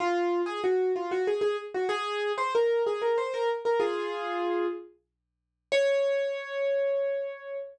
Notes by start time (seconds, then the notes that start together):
0.00 F4
0.46 G#4
0.64 F#4
0.96 F4
1.11 F#4
1.27 G#4
1.41 G#4
1.74 F#4
1.89 G#4
2.38 C5
2.55 A#4
2.87 G#4
3.02 A#4
3.18 C5
3.34 A#4
3.65 A#4
3.80 F4 G#4
5.72 C#5